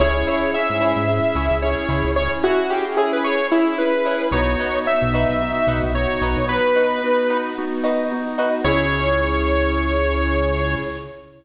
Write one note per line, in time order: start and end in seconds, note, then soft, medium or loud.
0.00 0.24 C#2 medium
0.00 0.49 C#4 medium
0.00 0.11 E4 medium
0.00 0.49 E4 medium
0.00 0.49 G#4 medium
0.00 0.11 G#4 medium
0.00 0.51 C#5 medium
0.00 0.11 C#5 medium
0.27 0.47 E4 medium
0.27 0.47 G#4 medium
0.27 0.47 C#5 medium
0.53 1.03 C#4 medium
0.53 1.03 E4 medium
0.53 1.03 G#4 medium
0.53 1.57 E5 medium
0.70 0.94 G#2 medium
0.81 1.01 E4 medium
0.81 1.01 G#4 medium
0.81 1.01 C#5 medium
0.96 1.20 G#2 medium
1.08 1.57 C#4 medium
1.08 1.57 E4 medium
1.08 1.57 G#4 medium
1.35 1.49 C#2 medium
1.35 1.55 E4 medium
1.35 1.55 G#4 medium
1.35 1.55 C#5 medium
1.51 1.75 C#2 medium
1.62 2.12 C#4 medium
1.62 2.12 E4 medium
1.62 2.12 G#4 medium
1.62 2.11 C#5 medium
1.89 2.03 C#2 medium
1.89 2.09 E4 medium
1.89 2.09 G#4 medium
1.89 2.09 C#5 medium
2.05 2.28 C#2 medium
2.16 2.65 C#4 medium
2.16 2.65 E4 medium
2.16 2.65 G#4 medium
2.16 2.31 C#5 medium
2.43 2.64 E4 medium
2.43 2.70 F#4 medium
2.43 2.64 G#4 medium
2.43 2.64 C#5 medium
2.70 3.20 C#4 medium
2.70 3.20 E4 medium
2.70 2.85 G4 medium
2.70 3.20 G#4 medium
2.97 3.17 E4 medium
2.97 3.12 G#4 medium
2.97 3.17 G#4 medium
2.97 3.17 C#5 medium
3.13 3.24 B4 medium
3.24 3.73 C#4 medium
3.24 3.73 E4 medium
3.24 3.73 G#4 medium
3.24 3.47 C#5 medium
3.51 3.72 E4 medium
3.51 3.78 E4 medium
3.51 3.72 G#4 medium
3.51 3.72 C#5 medium
3.78 4.28 C#4 medium
3.78 4.28 E4 medium
3.78 4.28 G#4 medium
3.78 4.26 B4 medium
4.05 4.16 E4 medium
4.05 4.16 G#4 medium
4.05 4.16 C#5 medium
4.32 4.56 B1 medium
4.32 4.82 B3 medium
4.32 4.43 D#4 medium
4.32 4.82 D#4 medium
4.32 4.82 F#4 medium
4.32 4.43 F#4 medium
4.32 4.43 B4 medium
4.32 4.79 C#5 medium
4.59 4.80 D#4 medium
4.59 4.80 F#4 medium
4.59 4.80 B4 medium
4.87 5.36 B3 medium
4.87 5.36 D#4 medium
4.87 5.36 F#4 medium
4.87 5.82 E5 medium
5.02 5.26 B1 medium
5.14 5.34 D#4 medium
5.14 5.34 F#4 medium
5.14 5.34 B4 medium
5.29 5.53 B1 medium
5.41 5.90 B3 medium
5.41 5.90 D#4 medium
5.41 5.90 F#4 medium
5.67 5.81 B1 medium
5.67 5.88 D#4 medium
5.67 5.88 F#4 medium
5.67 5.88 B4 medium
5.83 6.07 B1 medium
5.94 6.43 B3 medium
5.94 6.43 D#4 medium
5.94 6.43 F#4 medium
5.94 6.46 C#5 medium
6.21 6.35 B1 medium
6.21 6.42 D#4 medium
6.21 6.42 F#4 medium
6.21 6.42 B4 medium
6.37 6.61 B1 medium
6.49 6.98 B3 medium
6.49 6.98 D#4 medium
6.49 6.98 F#4 medium
6.49 7.37 B4 medium
6.76 6.96 D#4 medium
6.76 6.96 F#4 medium
6.76 6.96 B4 medium
7.03 7.52 B3 medium
7.03 7.52 D#4 medium
7.03 7.52 F#4 medium
7.30 7.50 D#4 medium
7.30 7.50 F#4 medium
7.30 7.50 B4 medium
7.57 8.07 B3 medium
7.57 8.07 D#4 medium
7.57 8.07 F#4 medium
7.84 8.04 D#4 medium
7.84 8.04 F#4 medium
7.84 8.04 B4 medium
8.11 8.60 B3 medium
8.11 8.60 D#4 medium
8.11 8.60 F#4 medium
8.38 8.49 D#4 medium
8.38 8.49 F#4 medium
8.38 8.49 B4 medium
8.64 10.75 C#2 loud
8.64 10.76 C#4 medium
8.64 10.75 E4 medium
8.64 10.76 E4 loud
8.64 10.75 G#4 loud
8.64 10.76 G#4 loud
8.64 10.75 C#5 loud